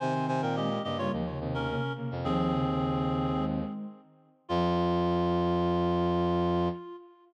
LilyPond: <<
  \new Staff \with { instrumentName = "Clarinet" } { \time 4/4 \key f \minor \tempo 4 = 107 <c'' aes''>8 <c'' aes''>16 <bes' g''>16 <g' ees''>8 <g' ees''>16 <f' des''>16 r8. <des' bes'>8. r8 | <c' aes'>2~ <c' aes'>8 r4. | f'1 | }
  \new Staff \with { instrumentName = "Brass Section" } { \time 4/4 \key f \minor <ees c'>4. <des bes>16 <des bes>8 r16 <ees c'>16 <des bes>16 <des bes>16 r16 <des bes>16 r16 | <ees c'>2~ <ees c'>8 r4. | f'1 | }
  \new Staff \with { instrumentName = "Ocarina" } { \clef bass \time 4/4 \key f \minor r4 aes8 r16 g16 f16 des16 c8 c8 c8 | f8 des16 des4~ des16 aes4 r4 | f1 | }
  \new Staff \with { instrumentName = "Brass Section" } { \clef bass \time 4/4 \key f \minor c16 c16 c16 bes,8. g,8 ees,8 ees,8. r8 f,16 | ees,2. r4 | f,1 | }
>>